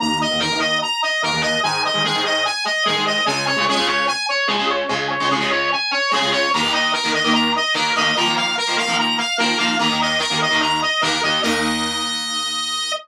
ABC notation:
X:1
M:4/4
L:1/16
Q:1/4=147
K:Ebdor
V:1 name="Brass Section"
b2 e2 B2 e2 b2 e2 B2 e2 | a2 e2 A2 e2 a2 e2 A2 e2 | a2 d2 A2 d2 a2 d2 A2 d2 | a2 d2 A2 d2 a2 d2 A2 d2 |
b2 e2 B2 e2 b2 e2 B2 e2 | b2 f2 B2 f2 b2 f2 B2 f2 | b2 e2 B2 e2 b2 e2 B2 e2 | e16 |]
V:2 name="Overdriven Guitar"
[E,,E,B,]3 [E,,E,B,] [E,,E,B,] [E,,E,B,]7 [E,,E,B,] [E,,E,B,]3 | [A,,E,A,]3 [A,,E,A,] [A,,E,A,] [A,,E,A,]7 [A,,E,A,] [A,,E,A,]3 | [D,,D,A,]3 [D,,D,A,] [D,,D,A,] [D,,D,A,]7 [D,,D,A,] [D,,D,A,]3 | [D,,D,A,]3 [D,,D,A,] [D,,D,A,] [D,,D,A,]7 [D,,D,A,] [D,,D,A,]3 |
[E,,E,B,] [E,,E,B,]4 [E,,E,B,]2 [E,,E,B,]5 [E,,E,B,]2 [E,,E,B,]2 | [E,F,B,] [E,F,B,]4 [E,F,B,]2 [E,F,B,]5 [E,F,B,]2 [E,F,B,]2 | [E,,E,B,] [E,,E,B,]4 [E,,E,B,]2 [E,,E,B,]5 [E,,E,B,]2 [E,,E,B,]2 | [E,,E,B,]16 |]